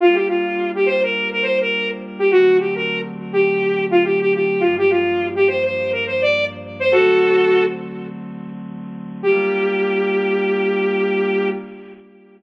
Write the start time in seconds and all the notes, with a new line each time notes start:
0.00 G3 A#3 D4 F4
0.14 G4
0.28 F4
0.75 G4
0.86 C5
1.03 A#4
1.32 A#4
1.43 C5
1.61 A#4
2.19 G4
2.30 D3 F#3 A3 C4 F#4
2.59 G4
2.75 A#4
3.33 G4
3.91 F4
4.04 G4
4.20 G4
4.34 G4
4.60 G2 F3 A#3 D4 F4
4.78 G4
4.90 F4
5.35 G4
5.48 C5
5.64 C5
5.92 A#4
6.06 C5
6.22 D5
6.79 C5
6.92 D3 F#3 A3 C4 F#4 A4
9.23 G3 A#3 D4 F4 G4